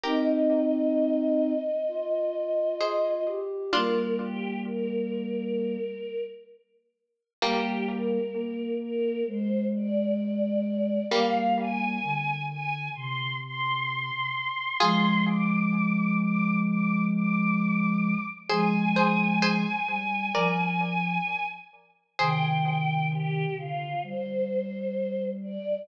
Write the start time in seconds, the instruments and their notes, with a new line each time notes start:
0.03 ocarina C4 D#4, harpsichord G4 A#4, choir aahs D#5
1.88 ocarina F4
2.81 harpsichord G#4 C5
3.27 ocarina G4
3.72 ocarina G3 A#3, harpsichord D4 F4, choir aahs A#4
4.21 choir aahs G4
4.65 choir aahs A#4
7.42 harpsichord G3 A#3, ocarina G3 A#3, choir aahs G4
7.87 choir aahs A#4
8.34 ocarina A#3
8.80 choir aahs A#4
9.27 ocarina G#3, choir aahs C5
9.74 choir aahs D5
11.10 ocarina G3 A#3, harpsichord G3 A#3, choir aahs F5
11.60 choir aahs G#5
12.04 ocarina D3
12.49 choir aahs G#5
12.95 ocarina C3, choir aahs C6
13.44 choir aahs C6
14.79 ocarina F3 G#3, harpsichord F4 G#4, choir aahs C6
15.27 choir aahs D6
16.19 choir aahs D6
16.65 choir aahs D6
17.13 choir aahs D6
18.50 ocarina F3 G#3, harpsichord G#4 C5, choir aahs G#5
18.96 harpsichord G#4 C5
19.42 harpsichord G#4 C5
19.88 ocarina G3
20.34 ocarina F3, harpsichord A#4 D5
22.19 ocarina C3 D#3, harpsichord G#4 C5, choir aahs G5
23.12 choir aahs G4
23.58 ocarina D3, choir aahs F4
24.03 ocarina G3, choir aahs C5
25.42 choir aahs D5